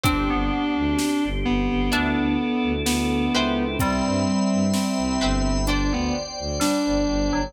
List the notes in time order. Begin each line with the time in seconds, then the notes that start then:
0.04 G1 C4 D4 G4 C5 D5 G5, kick, closed hi-hat
0.30 G1 B3
0.77 D2
0.99 snare
1.24 G1
1.45 G1 B3
1.70 G1
1.92 D2 D4 E4 A4 D5 E5 A5, closed hi-hat
2.18 D2
2.64 D2
2.86 D2 B3, snare
3.34 C#2 B4 C5 E5 G5
3.79 C2 G3 C4 C5 E5 G5 B5, kick, closed hi-hat
4.06 G2
4.53 G2
4.73 C4, snare
4.98 C2
5.21 G1 B4 C5 E5 G5
5.67 D4 C5 D5 G5, closed hi-hat
5.91 D2 B3
6.39 D2
6.60 G3 D4, snare
6.86 G1
7.07 G1
7.33 G1 F#3